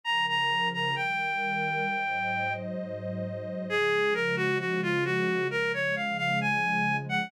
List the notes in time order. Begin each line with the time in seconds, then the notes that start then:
0.03 C#3 F3 A#4 A#5
0.28 A#5
0.73 A#5
0.96 D#3 G3 A#4 G5
1.86 G#2 F#3 C5 D#5
3.68 C#3 F3 G#3 G#4
4.14 A#4
4.36 F#4
4.59 F#4
4.82 F4
5.05 F#4
5.49 C#3 F3 G#3 A#4
5.73 C#5
5.96 F5
6.18 F5
6.41 G#5
7.09 F#5